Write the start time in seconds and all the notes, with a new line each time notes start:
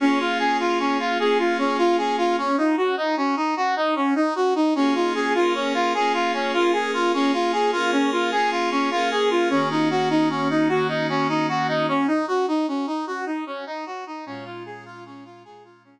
0.00 A#3 C#4 F4 G#4
0.20 F4
0.39 G#4
0.60 F4
0.80 C#4
0.99 F4
1.19 A#3 C#4 F4 G#4
1.39 F4
1.58 C#4
1.78 F4
1.98 G#4
2.18 F4
2.38 C#4
2.58 D#4
2.77 F#4
2.97 D#4
3.17 C#4
3.36 D#4
3.57 F#4
3.76 D#4
3.96 C#4
4.15 D#4
4.35 F#4
4.55 D#4
4.75 A#3 C#4 F4 G#4
4.95 F4
5.15 G#4
5.35 A#3 C#4 F4 G#4 A#4
5.54 C#4
5.74 F4
5.94 A#3 C#4 F4 G#4
6.14 F4
6.33 C#4
6.53 A#3 C#4 F4 G#4 A#4
6.73 G#4
6.94 F4
7.13 A#3 C#4 F4 G#4
7.33 F4
7.52 G#4
7.72 A#3 C#4 F4 G#4 A#4
7.92 C#4
8.12 F4
8.32 A#3 C#4 F4 G#4
8.51 F4
8.71 C#4
8.91 A#3 C#4 F4 G#4 A#4
9.11 G#4
9.30 F4
9.50 D#3 A#3 C#4 F#4
9.70 D#4
9.90 F#4
10.10 D#4
10.30 C#4
10.50 D#4
10.69 D#3 A#3 C#4 F#4
10.88 D#4
11.09 C#4
11.29 D#4
11.49 F#4
11.68 D#4
11.88 C#4
12.07 D#4
12.28 F#4
12.48 D#4
12.68 C#4
12.87 D#4
13.07 F#4
13.26 D#4
13.46 C#4
13.67 D#4
13.86 F#4
14.07 D#4
14.26 A#2 G#3 C#4 F4
14.45 F4
14.66 G#4
14.85 F4
15.06 C#4
15.25 F4
15.45 A#2 G#3 C#4 F4 G#4
15.64 F4
15.84 C#4